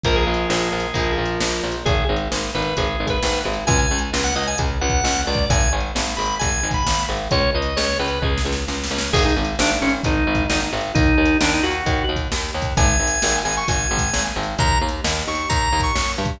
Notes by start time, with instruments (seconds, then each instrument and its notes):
0.04 electric bass (finger) A#1, overdriven guitar F3 A#3, drawbar organ A#4, kick, closed hi-hat
0.16 drawbar organ G#4
0.27 electric bass (finger) A#1
0.34 closed hi-hat
0.50 electric bass (finger) A#1, snare
0.72 electric bass (finger) A#1
0.80 closed hi-hat
0.94 electric bass (finger) A#1, overdriven guitar F3 A#3, kick, closed hi-hat
1.18 electric bass (finger) A#1
1.25 closed hi-hat
1.40 electric bass (finger) A#1, snare
1.63 electric bass (finger) A#1
1.72 closed hi-hat
1.85 electric bass (finger) G#1, drawbar organ G#4, kick, closed hi-hat
2.09 electric bass (finger) G#1
2.16 closed hi-hat
2.32 electric bass (finger) G#1, snare
2.55 electric bass (finger) G#1, drawbar organ B4
2.62 closed hi-hat
2.77 electric bass (finger) G#1, drawbar organ G#4, kick, closed hi-hat
3.00 electric bass (finger) G#1
3.07 drawbar organ B4, kick, closed hi-hat
3.23 electric bass (finger) G#1, snare
3.45 electric bass (finger) G#1
3.53 closed hi-hat
3.67 electric bass (finger) C#2, drawbar organ G#5, kick, closed hi-hat
3.79 drawbar organ G#5
3.91 electric bass (finger) C#2
3.99 closed hi-hat
4.13 electric bass (finger) C#2, snare
4.24 drawbar organ F#5
4.36 electric bass (finger) C#2, drawbar organ D#5
4.43 closed hi-hat
4.47 drawbar organ G#5
4.58 electric bass (finger) C#2, kick, closed hi-hat
4.81 electric bass (finger) C#2, drawbar organ F#5
4.89 kick, closed hi-hat
5.04 electric bass (finger) C#2, snare
5.27 electric bass (finger) C#2, drawbar organ D5
5.34 kick, closed hi-hat
5.50 electric bass (finger) G#1, drawbar organ G#5, kick, closed hi-hat
5.73 electric bass (finger) G#1
5.80 closed hi-hat
5.95 electric bass (finger) G#1, snare
6.17 electric bass (finger) G#1, drawbar organ B5
6.25 closed hi-hat
6.39 electric bass (finger) G#1, drawbar organ G#5, kick, closed hi-hat
6.63 electric bass (finger) G#1
6.71 drawbar organ B5, kick, closed hi-hat
6.86 electric bass (finger) G#1, snare
7.09 electric bass (finger) G#1
7.17 closed hi-hat
7.31 electric bass (finger) C#2, drawbar organ C#5, kick, closed hi-hat
7.55 electric bass (finger) C#2, drawbar organ D#5
7.62 closed hi-hat
7.77 electric bass (finger) C#2, drawbar organ C#5, snare
7.99 electric bass (finger) C#2, drawbar organ B4
8.08 closed hi-hat
8.22 electric bass (finger) C#2, drawbar organ G#4, kick
8.38 snare
8.45 electric bass (finger) C#2
8.52 snare
8.68 electric bass (finger) C#2, snare
8.84 snare
8.91 electric bass (finger) C#2
8.98 snare
9.13 electric bass (finger) G#1, drawbar organ G#4, kick, crash
9.25 drawbar organ D#4
9.36 electric bass (finger) G#1
9.45 closed hi-hat
9.59 electric bass (finger) G#1, drawbar organ D4, snare
9.82 electric bass (finger) G#1, drawbar organ C#4
9.89 closed hi-hat
10.04 electric bass (finger) G#1, drawbar organ D#4, kick, closed hi-hat
10.27 electric bass (finger) G#1
10.35 kick, closed hi-hat
10.50 electric bass (finger) G#1, drawbar organ D#4, snare
10.73 electric bass (finger) G#1
10.81 closed hi-hat
10.95 electric bass (finger) D#2, drawbar organ D#4, kick, closed hi-hat
11.18 electric bass (finger) D#2
11.25 closed hi-hat
11.41 electric bass (finger) D#2, drawbar organ D4, snare
11.54 drawbar organ D#4
11.63 electric bass (finger) D#2, drawbar organ F#4
11.71 closed hi-hat
11.86 electric bass (finger) D#2, kick, closed hi-hat
12.09 electric bass (finger) D#2
12.16 kick, closed hi-hat
12.32 electric bass (finger) D#2, snare
12.54 electric bass (finger) D#2
12.62 kick, closed hi-hat
12.77 electric bass (finger) G#1, drawbar organ G#5, kick, closed hi-hat
13.00 electric bass (finger) G#1
13.07 closed hi-hat
13.22 electric bass (finger) G#1, snare
13.45 electric bass (finger) G#1, drawbar organ G#5
13.52 closed hi-hat
13.57 drawbar organ C#6
13.68 electric bass (finger) G#1, drawbar organ G#5, kick, closed hi-hat
13.91 electric bass (finger) G#1
13.98 kick, closed hi-hat
14.13 electric bass (finger) G#1, snare
14.36 electric bass (finger) G#1
14.43 closed hi-hat
14.59 electric bass (finger) D#2, drawbar organ A#5, kick, closed hi-hat
14.81 electric bass (finger) D#2
14.89 closed hi-hat
15.04 electric bass (finger) D#2, snare
15.27 electric bass (finger) D#2, drawbar organ C#6
15.35 closed hi-hat
15.49 electric bass (finger) D#2, drawbar organ A#5, kick, closed hi-hat
15.72 electric bass (finger) D#2
15.80 drawbar organ C#6, kick, closed hi-hat
15.95 electric bass (finger) F#2, snare
16.18 electric bass (finger) G2
16.25 kick, closed hi-hat